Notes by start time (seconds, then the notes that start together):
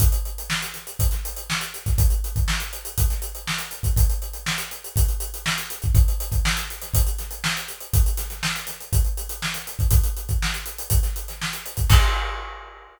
0.00 kick, closed hi-hat
0.12 closed hi-hat
0.25 closed hi-hat
0.38 closed hi-hat
0.50 snare
0.61 snare, closed hi-hat
0.74 snare, closed hi-hat
0.87 closed hi-hat
0.99 kick, closed hi-hat
1.11 snare, closed hi-hat
1.25 closed hi-hat
1.36 closed hi-hat
1.50 snare
1.61 closed hi-hat
1.74 closed hi-hat
1.85 kick, snare, closed hi-hat
1.98 kick, closed hi-hat
2.10 closed hi-hat
2.24 closed hi-hat
2.36 kick, closed hi-hat
2.48 snare
2.60 snare, closed hi-hat
2.73 closed hi-hat
2.85 closed hi-hat
2.98 kick, closed hi-hat
3.10 snare, closed hi-hat
3.22 closed hi-hat
3.35 closed hi-hat
3.47 snare
3.58 closed hi-hat
3.71 closed hi-hat
3.83 kick, closed hi-hat
3.96 kick, closed hi-hat
4.10 closed hi-hat
4.22 closed hi-hat
4.33 closed hi-hat
4.46 snare
4.58 closed hi-hat
4.71 closed hi-hat
4.84 closed hi-hat
4.96 kick, closed hi-hat
5.08 closed hi-hat
5.20 closed hi-hat
5.34 closed hi-hat
5.46 snare
5.58 closed hi-hat
5.70 closed hi-hat
5.82 kick, closed hi-hat
5.95 kick, closed hi-hat
6.08 closed hi-hat
6.20 closed hi-hat
6.32 kick, closed hi-hat
6.45 snare
6.57 snare, closed hi-hat
6.70 closed hi-hat
6.81 snare, closed hi-hat
6.94 kick, closed hi-hat
7.07 closed hi-hat
7.18 snare, closed hi-hat
7.31 closed hi-hat
7.44 snare
7.57 closed hi-hat
7.68 closed hi-hat
7.80 closed hi-hat
7.93 kick, closed hi-hat
8.06 closed hi-hat
8.17 snare, closed hi-hat
8.30 snare, closed hi-hat
8.43 snare
8.56 closed hi-hat
8.67 snare, closed hi-hat
8.80 closed hi-hat
8.93 kick, closed hi-hat
9.05 closed hi-hat
9.17 closed hi-hat
9.29 closed hi-hat
9.42 snare
9.54 snare, closed hi-hat
9.67 closed hi-hat
9.79 kick, closed hi-hat
9.91 kick, closed hi-hat
10.04 closed hi-hat
10.17 closed hi-hat
10.29 kick, closed hi-hat
10.42 snare
10.54 closed hi-hat
10.66 closed hi-hat
10.78 closed hi-hat
10.90 kick, closed hi-hat
11.03 snare, closed hi-hat
11.16 closed hi-hat
11.28 snare, closed hi-hat
11.42 snare
11.53 closed hi-hat
11.66 closed hi-hat
11.77 kick, closed hi-hat
11.90 kick, crash